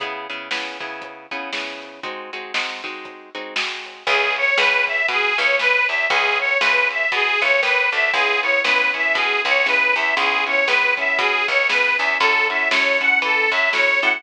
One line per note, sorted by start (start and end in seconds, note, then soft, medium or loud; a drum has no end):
0.00 0.27 C#3 loud
0.00 0.27 B3 loud
0.00 0.27 E4 loud
0.00 0.27 G#4 loud
0.00 kick loud
0.00 closed hi-hat loud
0.30 0.49 C#3 medium
0.30 0.49 B3 medium
0.30 0.49 E4 medium
0.30 0.49 G#4 medium
0.30 closed hi-hat medium
0.51 0.78 C#3 medium
0.51 0.78 B3 medium
0.51 0.78 E4 medium
0.51 0.78 G#4 medium
0.51 snare medium
0.80 1.26 C#3 medium
0.80 1.26 B3 medium
0.80 1.26 E4 medium
0.80 1.26 G#4 medium
0.80 kick medium
0.80 closed hi-hat medium
1.02 kick medium
1.02 closed hi-hat medium
1.31 1.51 C#3 medium
1.31 1.51 B3 medium
1.31 1.51 E4 medium
1.31 1.51 G#4 medium
1.31 kick medium
1.31 closed hi-hat medium
1.53 2.00 C#3 medium
1.53 2.00 B3 medium
1.53 2.00 E4 medium
1.53 2.00 G#4 medium
1.53 snare medium
1.82 closed hi-hat medium
2.03 2.31 G#3 medium
2.03 2.31 C4 medium
2.03 2.31 D#4 loud
2.03 2.31 F#4 loud
2.03 kick medium
2.03 closed hi-hat medium
2.33 2.53 G#3 medium
2.33 2.53 C4 medium
2.33 2.53 D#4 medium
2.33 2.53 F#4 medium
2.33 closed hi-hat medium
2.54 2.81 G#3 medium
2.54 2.81 C4 medium
2.54 2.81 D#4 loud
2.54 2.81 F#4 medium
2.54 snare loud
2.84 3.30 G#3 medium
2.84 3.30 C4 medium
2.84 3.30 D#4 medium
2.84 3.30 F#4 medium
2.84 kick medium
2.84 closed hi-hat medium
3.05 kick medium
3.05 closed hi-hat medium
3.35 3.54 G#3 medium
3.35 3.54 C4 medium
3.35 3.54 D#4 medium
3.35 3.54 F#4 loud
3.35 kick medium
3.35 closed hi-hat medium
3.56 4.03 G#3 medium
3.56 4.03 C4 medium
3.56 4.03 D#4 medium
3.56 4.03 F#4 medium
3.56 snare loud
3.85 closed hi-hat medium
4.07 4.51 C#2 loud
4.07 4.35 G#4 medium
4.07 4.54 B4 loud
4.07 4.54 C#5 loud
4.07 4.54 E5 loud
4.07 4.54 G#5 loud
4.07 kick loud
4.07 crash medium
4.36 4.57 C#5 medium
4.36 ride medium
4.58 5.02 C#2 loud
4.58 5.31 B4 medium
4.58 4.85 B4 medium
4.58 5.31 C#5 loud
4.58 5.31 E5 medium
4.58 5.31 G#5 medium
4.58 snare loud
4.87 5.06 E5 medium
4.87 kick medium
4.87 ride medium
5.08 5.33 B2 medium
5.08 5.37 G#4 medium
5.08 kick medium
5.08 ride loud
5.37 5.80 C#2 medium
5.37 5.58 B4 medium
5.37 5.57 C#5 medium
5.37 5.58 C#5 medium
5.37 5.58 E5 medium
5.37 5.58 G#5 medium
5.37 kick medium
5.37 ride medium
5.59 5.86 B4 medium
5.59 6.07 B4 loud
5.59 6.07 C#5 medium
5.59 6.07 E5 medium
5.59 6.07 G#5 medium
5.59 snare loud
5.88 6.07 E2 medium
5.88 6.07 E5 medium
5.88 ride medium
6.10 6.55 C#2 loud
6.10 6.38 G#4 medium
6.10 6.58 B4 loud
6.10 6.58 C#5 loud
6.10 6.58 E5 loud
6.10 6.58 G#5 loud
6.10 kick loud
6.10 ride medium
6.39 6.58 C#5 medium
6.39 ride medium
6.60 7.05 C#2 medium
6.60 6.88 B4 medium
6.60 7.34 B4 loud
6.60 7.34 C#5 medium
6.60 7.34 E5 medium
6.60 7.34 G#5 medium
6.60 snare loud
6.90 7.10 E5 medium
6.90 ride medium
7.12 7.37 B2 medium
7.12 7.41 G#4 medium
7.12 kick medium
7.12 ride loud
7.41 7.62 C#2 medium
7.41 7.61 B4 medium
7.41 7.60 C#5 medium
7.41 7.61 C#5 loud
7.41 7.61 E5 loud
7.41 7.61 G#5 medium
7.41 ride medium
7.63 7.89 D#2 medium
7.63 7.90 B4 medium
7.63 8.10 B4 medium
7.63 8.10 C#5 loud
7.63 8.10 E5 loud
7.63 8.10 G#5 loud
7.63 snare medium
7.92 8.11 D2 medium
7.92 8.12 E5 medium
7.92 ride medium
8.13 8.58 C#2 medium
8.13 8.41 B3 loud
8.13 8.41 C#4 loud
8.13 8.41 E4 loud
8.13 8.40 G#4 medium
8.13 8.41 G#4 loud
8.13 kick loud
8.13 ride medium
8.42 8.63 B3 medium
8.42 8.63 C#4 medium
8.42 8.63 E4 medium
8.42 8.63 G#4 medium
8.42 8.61 C#5 medium
8.42 ride medium
8.64 9.09 C#2 medium
8.64 8.92 B3 loud
8.64 8.92 C#4 medium
8.64 8.92 E4 medium
8.64 8.92 G#4 medium
8.64 8.91 B4 medium
8.64 snare loud
8.94 9.61 B3 medium
8.94 9.61 C#4 medium
8.94 9.61 E4 medium
8.94 9.61 G#4 medium
8.94 9.15 E5 medium
8.94 kick medium
8.94 ride medium
9.14 9.40 B2 medium
9.14 9.42 G#4 medium
9.14 kick medium
9.14 ride loud
9.45 9.87 C#2 medium
9.45 9.66 C#5 medium
9.45 kick medium
9.45 ride medium
9.66 9.93 B3 medium
9.66 9.93 C#4 medium
9.66 9.93 E4 medium
9.66 9.93 G#4 loud
9.66 9.94 B4 medium
9.66 snare medium
9.95 10.14 E2 medium
9.95 10.15 B3 medium
9.95 10.15 C#4 medium
9.95 10.15 E4 medium
9.95 10.15 G#4 medium
9.95 10.15 E5 medium
9.95 ride medium
10.17 10.61 C#2 loud
10.17 10.44 B3 medium
10.17 10.44 C#4 loud
10.17 10.44 E4 loud
10.17 10.44 G#4 loud
10.17 10.44 G#4 medium
10.17 kick medium
10.17 ride medium
10.47 10.66 B3 medium
10.47 10.66 C#4 medium
10.47 10.66 E4 loud
10.47 10.66 G#4 medium
10.47 10.67 C#5 medium
10.47 ride medium
10.67 11.12 C#2 medium
10.67 10.95 B3 loud
10.67 10.95 C#4 medium
10.67 10.95 E4 medium
10.67 10.95 G#4 loud
10.67 10.94 B4 medium
10.67 snare loud
10.97 11.64 B3 loud
10.97 11.64 C#4 medium
10.97 11.64 E4 medium
10.97 11.64 G#4 medium
10.97 11.17 E5 medium
10.97 kick medium
10.97 ride medium
11.19 11.44 B2 medium
11.19 11.46 G#4 medium
11.19 kick medium
11.19 ride loud
11.48 11.90 C#2 medium
11.48 11.68 C#5 medium
11.48 kick medium
11.48 ride medium
11.69 11.97 B3 medium
11.69 11.97 C#4 loud
11.69 11.97 E4 medium
11.69 11.97 G#4 medium
11.69 11.96 B4 medium
11.69 snare loud
11.97 12.17 E2 medium
11.97 12.19 B3 loud
11.97 12.19 C#4 medium
11.97 12.19 E4 medium
11.97 12.19 G#4 medium
11.97 12.17 E5 medium
11.97 ride medium
12.20 12.65 F#2 loud
12.20 12.48 C#4 loud
12.20 12.48 E4 loud
12.20 12.48 F#4 loud
12.20 12.47 A4 medium
12.20 12.48 A4 loud
12.20 kick loud
12.20 crash loud
12.49 12.69 C#4 loud
12.49 12.69 E4 medium
12.49 12.69 F#4 loud
12.49 12.69 A4 loud
12.49 12.69 E5 medium
12.49 ride medium
12.71 13.16 F#2 medium
12.71 12.98 C#4 loud
12.71 12.98 E4 medium
12.71 12.98 F#4 loud
12.71 12.98 A4 medium
12.71 12.99 C#5 medium
12.71 snare loud
13.00 13.68 C#4 loud
13.00 13.68 E4 loud
13.00 13.68 F#4 medium
13.00 13.68 A4 loud
13.00 13.19 F#5 medium
13.00 kick medium
13.00 ride medium
13.22 13.47 E3 medium
13.22 13.50 A4 medium
13.22 kick medium
13.22 ride loud
13.51 13.94 F#2 medium
13.51 13.71 E5 medium
13.51 kick medium
13.51 ride medium
13.73 14.00 C#4 medium
13.73 14.00 E4 loud
13.73 14.00 F#4 loud
13.73 14.00 A4 loud
13.73 14.00 C#5 medium
13.73 snare loud
14.02 14.21 A2 loud
14.02 14.22 C#4 loud
14.02 14.22 E4 loud
14.02 14.22 F#4 medium
14.02 14.22 A4 loud
14.02 14.22 F#5 medium
14.02 ride medium